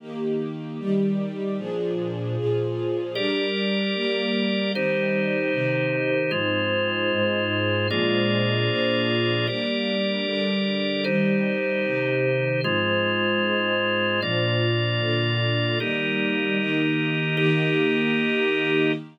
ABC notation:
X:1
M:6/8
L:1/8
Q:3/8=76
K:Eb
V:1 name="String Ensemble 1"
[E,B,G]3 [E,G,G]3 | [B,,F,DA]3 [B,,F,FA]3 | [G,DB]3 [G,B,B]3 | [E,G,C]3 [C,E,C]3 |
[A,,F,C]3 [A,,A,C]3 | [B,,F,A,D]3 [B,,F,B,D]3 | [G,B,D]3 [D,G,D]3 | [E,G,C]3 [C,E,C]3 |
[A,,F,C]3 [A,,A,C]3 | [B,,F,D]3 [B,,D,D]3 | [E,G,B,]3 [E,B,E]3 | [E,B,G]6 |]
V:2 name="Drawbar Organ"
z6 | z6 | [GBd]6 | [EGc]6 |
[A,Fc]6 | [B,FAd]6 | [GBd]6 | [EGc]6 |
[A,Fc]6 | [B,Fd]6 | [EGB]6 | [EGB]6 |]